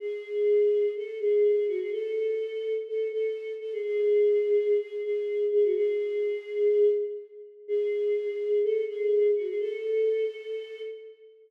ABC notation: X:1
M:4/4
L:1/16
Q:1/4=125
K:A
V:1 name="Choir Aahs"
G8 A2 G4 F G | A8 A2 A4 A G | G8 G2 G4 G F | G10 z6 |
G8 A2 G4 F G | A12 z4 |]